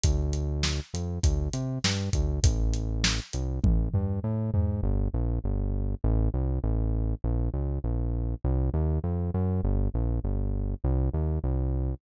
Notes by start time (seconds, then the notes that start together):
0.04 D2, kick, closed hi-hat
0.33 closed hi-hat
0.63 snare
0.94 F2, closed hi-hat
1.24 D2, kick, closed hi-hat
1.53 C3, closed hi-hat
1.84 G2, snare
2.13 D2, kick, closed hi-hat
2.43 A1, kick, closed hi-hat
2.74 closed hi-hat
3.04 snare
3.33 C2, closed hi-hat
3.64 A1, kick, high tom
3.94 G2, floor tom
4.24 A2
4.54 G#2, floor tom
4.83 G1
5.14 A#1
5.44 G1
6.04 A1
6.34 C2
6.64 A1
7.24 A#1
7.54 C#2
7.84 A#1
8.44 C2
8.74 D#2
9.04 F2
9.34 F#2
9.63 G1
9.94 A#1
10.24 G1
10.84 C2
11.13 D#2
11.44 C2